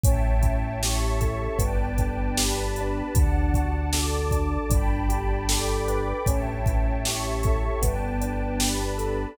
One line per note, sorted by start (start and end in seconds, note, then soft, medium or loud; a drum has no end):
0.03 1.48 A1 loud
0.03 1.53 C#4 medium
0.03 0.81 C#5 medium
0.03 0.81 E5 medium
0.03 0.81 G5 medium
0.03 0.81 A5 loud
0.03 kick medium
0.03 closed hi-hat loud
0.41 1.52 E4 medium
0.41 kick medium
0.41 closed hi-hat medium
0.82 1.57 G4 medium
0.82 1.59 C#5 medium
0.82 1.59 E5 loud
0.82 1.59 A5 medium
0.82 1.59 C#6 medium
0.82 snare medium
1.20 1.57 A4 medium
1.20 kick medium
1.20 closed hi-hat medium
1.58 3.02 G1 loud
1.58 3.06 B3 medium
1.58 2.37 B4 medium
1.58 2.37 D5 loud
1.58 2.37 G5 medium
1.58 2.37 A5 medium
1.58 kick medium
1.58 closed hi-hat medium
1.97 2.78 D4 medium
1.97 kick medium
1.97 closed hi-hat medium
2.37 3.11 G4 medium
2.37 3.14 B4 loud
2.37 3.14 D5 medium
2.37 3.14 A5 loud
2.37 3.14 B5 medium
2.37 snare loud
2.76 4.31 D4 medium
2.76 closed hi-hat medium
3.14 4.58 D2 loud
3.14 3.92 D5 loud
3.14 3.93 F#5 medium
3.14 3.92 A5 loud
3.14 kick medium
3.14 closed hi-hat medium
3.54 4.66 F#4 medium
3.54 kick medium
3.54 closed hi-hat medium
3.93 4.67 A4 medium
3.93 4.70 D5 medium
3.93 4.70 A5 loud
3.93 4.70 D6 medium
3.93 snare medium
4.31 4.69 D4 medium
4.31 kick medium
4.31 closed hi-hat medium
4.69 6.13 G1 loud
4.69 6.18 D4 medium
4.69 5.48 D5 medium
4.69 5.48 G5 loud
4.69 5.49 A5 loud
4.69 5.48 B5 loud
4.69 kick medium
4.69 closed hi-hat medium
5.09 6.20 G4 medium
5.09 closed hi-hat medium
5.49 6.23 A4 medium
5.49 6.26 D5 loud
5.49 6.26 G5 medium
5.49 6.26 B5 medium
5.49 6.26 D6 medium
5.49 snare medium
5.88 6.25 B4 medium
5.88 closed hi-hat medium
6.26 7.70 A1 loud
6.26 7.75 C#4 medium
6.26 7.04 C#5 medium
6.26 7.04 E5 medium
6.26 7.04 G5 medium
6.26 7.04 A5 medium
6.26 kick medium
6.26 closed hi-hat medium
6.66 7.79 E4 medium
6.66 kick medium
6.66 closed hi-hat medium
7.05 7.80 G4 medium
7.05 7.82 C#5 medium
7.05 7.82 E5 loud
7.05 7.82 A5 medium
7.05 7.82 C#6 medium
7.05 snare medium
7.43 7.81 A4 medium
7.43 kick medium
7.43 closed hi-hat medium
7.82 9.26 G1 loud
7.82 9.30 B3 medium
7.82 8.60 B4 loud
7.82 8.60 D5 medium
7.82 8.60 G5 medium
7.82 8.60 A5 medium
7.82 kick medium
7.82 closed hi-hat medium
8.21 9.32 D4 medium
8.21 closed hi-hat medium
8.60 9.35 G4 medium
8.60 9.37 B4 medium
8.60 9.37 D5 medium
8.60 9.37 A5 medium
8.60 9.37 B5 medium
8.60 snare medium
8.98 9.35 A4 medium
8.98 closed hi-hat medium